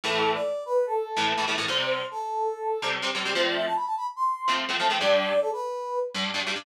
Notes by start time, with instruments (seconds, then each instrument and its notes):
0.04 overdriven guitar A2 E3 A3, brass section A4
0.34 brass section D5
0.66 brass section B4
0.86 brass section A4
1.16 overdriven guitar A2 E3 A3
1.37 overdriven guitar A2 E3 A3
1.47 overdriven guitar A2 E3 A3
1.58 overdriven guitar A2 E3 A3
1.68 overdriven guitar C3 G3 C4, brass section C5
2.11 brass section A4
2.82 overdriven guitar C3 G3 C4
3.02 overdriven guitar C3 G3 C4
3.15 overdriven guitar C3 G3 C4
3.25 overdriven guitar C3 G3 C4
3.34 overdriven guitar F3 A3 C4, brass section C5
3.45 brass section D5
3.55 brass section E5
3.66 brass section A5
3.76 brass section B5
3.86 brass section A5
3.97 brass section B5
4.16 brass section C6
4.48 overdriven guitar F3 A3 C4
4.69 overdriven guitar F3 A3 C4
4.79 overdriven guitar F3 A3 C4, brass section A5
4.90 overdriven guitar F3 A3 C4, brass section G5
5.00 overdriven guitar G2 G3 D4, brass section D5
5.41 brass section A4
5.53 brass section B4
6.14 overdriven guitar G2 G3 D4
6.34 overdriven guitar G2 G3 D4
6.46 overdriven guitar G2 G3 D4
6.56 overdriven guitar G2 G3 D4